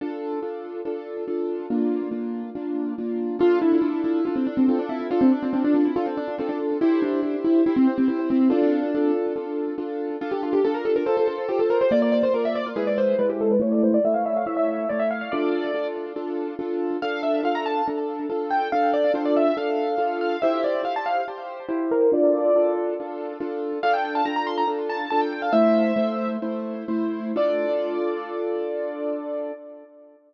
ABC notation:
X:1
M:4/4
L:1/16
Q:1/4=141
K:Dm
V:1 name="Acoustic Grand Piano"
z16 | z16 | F2 E4 E2 F C D C C D E2 | F C D C C D D E F C D2 C D z2 |
E2 D4 E2 E C C C C C C2 | D6 z10 | F G F G A B A B A A A2 G A B c | d d d c B e d F ^G d c2 =B =G A B |
^c d =c d e f e f e e e2 d e f f | d6 z10 | f2 e2 f b a2 z6 g2 | f2 d2 c d e2 f6 f2 |
e2 d2 f a f2 z6 B2 | d6 z10 | f g g a b b c' b z2 a2 a g g f | "^rit." e8 z8 |
d16 |]
V:2 name="Acoustic Grand Piano"
[DFA]4 [DFA]4 [DFA]4 [DFA]4 | [B,DF]4 [B,DF]4 [B,DF]4 [B,DF]4 | [DA]4 [DFA]4 [DA]4 [DFA]4 | [DA]4 [DFA]4 [DA]4 [DFA]4 |
[EGc]4 [EGc]4 [Gc]4 [EGc]4 | [FA]4 [DFA]4 [DFA]4 [DFA]4 | [DA]4 [DF]4 [Fc]4 [FAc]4 | [B,F]4 [B,Fd]4 [^G,E=B]4 [G,E]4 |
[A,E]4 [A,E^c]4 [A,Ec]4 [A,Ec]4 | [DFA]4 [DFA]4 [DFA]4 [DFA]4 | [DA]4 [DFA]4 [DA]4 [DFA]4 | [DA]4 [DFA]4 [DA]4 [DFA]4 |
[EGc]4 [EGc]4 [Gc]4 [EGc]4 | [DFA]4 [DFA]4 [DFA]4 [DFA]4 | [DFA]4 [DFA]4 [DFA]4 [DFA]4 | "^rit." [A,Ec]4 [A,Ec]4 [A,Ec]4 [A,Ec]4 |
[DFA]16 |]